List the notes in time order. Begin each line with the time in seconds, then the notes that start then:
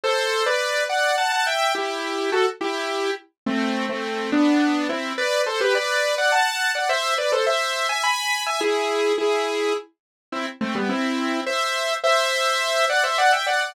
0.04 A4 C5
0.46 B4 D5
0.89 D5 F#5
1.18 F#5 A5
1.32 F#5 A5
1.46 E5 G5
1.75 E4 G4
2.32 F#4 A4
2.61 E4 G4
3.46 A3 C4
3.89 A3 C4
4.32 B3 D4
4.89 C4 E4
5.18 B4 D5
5.46 A4 C5
5.60 G4 B4
5.75 B4 D5
6.18 D5 F#5
6.32 F#5 A5
6.75 D5 F#5
6.89 C5 E5
7.18 B4 D5
7.32 A4 C5
7.46 C5 E5
7.89 E5 G#5
8.03 G#5 B5
8.46 E5 G#5
8.60 E4 G#4
9.18 E4 G#4
10.32 C4 E4
10.61 A3 C4
10.75 G3 B3
10.89 C4 E4
11.46 C5 E5
12.03 C5 E5
12.89 D5 F#5
13.03 C5 E5
13.18 D5 F#5
13.32 E5 G5
13.46 D5 F#5
13.61 D5 F#5